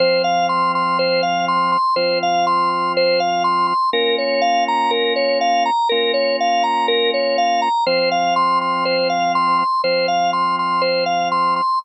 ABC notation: X:1
M:4/4
L:1/8
Q:1/4=122
K:Fm
V:1 name="Drawbar Organ"
c f c' c' c f c' c' | c f c' c' c f c' c' | B d f b B d f b | B d f b B d f b |
c f c' c' c f c' c' | c f c' c' c f c' c' |]
V:2 name="Drawbar Organ"
[F,CF]8 | [F,CF]8 | [B,DF]8 | [B,DF]8 |
[F,CF]8 | [F,CF]8 |]